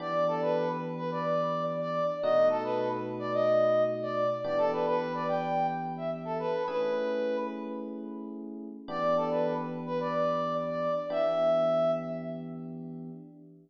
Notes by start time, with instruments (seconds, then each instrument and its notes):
0.00 electric piano 1 E3 B3 D4 G4, brass section D5
0.28 brass section A4
0.42 brass section B4
0.97 brass section B4
1.11 brass section D5
1.81 brass section D5
2.22 electric piano 1 B2 A3 D#4 F#4, brass section D#5
2.50 brass section A4
2.64 brass section B4
3.19 brass section D5
3.33 brass section D#5
4.02 brass section D5
4.44 electric piano 1 E3 B3 D4 G4, brass section D5
4.58 brass section A4
4.72 brass section B4
4.86 brass section B4
5.14 brass section D5
5.28 brass section G5
5.97 brass section E5
6.25 brass section A4
6.39 brass section B4
6.67 electric piano 1 A3 C#4 E4 G#4, brass section B4
8.88 electric piano 1 E3 B3 D4 G4, brass section D5
9.16 brass section A4
9.30 brass section B4
9.86 brass section B4
10.00 brass section D5
10.69 brass section D5
11.10 electric piano 1 E3 B3 D4 G4, brass section E5